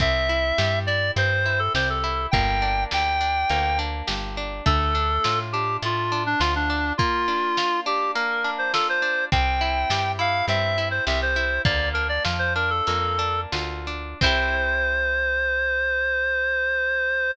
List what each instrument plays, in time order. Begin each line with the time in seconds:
0.00 electric bass (finger) C2, orchestral harp C4, clarinet E5, kick, closed hi-hat
0.29 orchestral harp E4
0.58 electric bass (finger) G2, orchestral harp G4, snare
0.87 orchestral harp E4, clarinet D5
1.16 electric bass (finger) G2, orchestral harp C4, clarinet C5, closed hi-hat
1.46 orchestral harp E4
1.59 clarinet A4
1.75 electric bass (finger) C2, orchestral harp G4, clarinet C5, snare
1.90 clarinet A4
2.04 orchestral harp E4
2.31 electric bass (finger) G1, orchestral harp A#3, clarinet G5, kick, closed hi-hat
2.62 orchestral harp D4
2.91 electric bass (finger) D2, orchestral harp G4, clarinet G5, snare
3.21 orchestral harp D4
3.50 electric bass (finger) D2, orchestral harp A#3, closed hi-hat
3.79 orchestral harp D4
4.07 electric bass (finger) G1, orchestral harp G4, snare
4.37 orchestral harp D4
4.66 electric bass (finger) D2, orchestral harp A3, clarinet A4, kick, closed hi-hat
4.95 orchestral harp D4
5.24 electric bass (finger) A2, orchestral harp F4, snare
5.52 orchestral harp D4, clarinet G4
5.82 electric bass (finger) A2, orchestral harp A3, clarinet F4, closed hi-hat
6.12 orchestral harp D4
6.26 clarinet D4
6.40 electric bass (finger) D2, clarinet F4, orchestral harp F4, snare
6.56 clarinet D4
6.70 orchestral harp D4
6.98 orchestral harp A#3, clarinet F4, kick, closed hi-hat
7.28 orchestral harp D4
7.57 orchestral harp F4, snare
7.86 orchestral harp D4, clarinet G4
8.15 orchestral harp A#3, clarinet A#4, closed hi-hat
8.44 orchestral harp D4
8.58 clarinet C5
8.74 orchestral harp F4, clarinet A4, snare
8.89 clarinet C5
9.02 orchestral harp D4
9.32 electric bass (finger) C2, orchestral harp C4, clarinet G5, kick, closed hi-hat
9.61 orchestral harp E4
9.90 electric bass (finger) G2, orchestral harp G4, snare
10.19 orchestral harp E4, clarinet F5
10.48 electric bass (finger) G2, orchestral harp C4, clarinet E5, closed hi-hat
10.78 orchestral harp E4
10.91 clarinet C5
11.07 electric bass (finger) C2, orchestral harp G4, clarinet E5, snare
11.22 clarinet C5
11.36 orchestral harp E4
11.65 electric bass (finger) D2, orchestral harp A#3, clarinet D5, kick, closed hi-hat
11.93 orchestral harp D4, clarinet A#4
12.09 clarinet D5
12.25 electric bass (finger) F2, orchestral harp F4, snare
12.39 clarinet C5
12.55 orchestral harp D4, clarinet A#4
12.70 clarinet A4
12.87 electric bass (finger) F2, orchestral harp A#3, closed hi-hat
13.19 orchestral harp D4
13.52 electric bass (finger) D2, orchestral harp F4, snare
13.87 orchestral harp D4
14.21 electric bass (finger) C2, orchestral harp C4 E4, clarinet C5, kick, crash
14.26 orchestral harp G4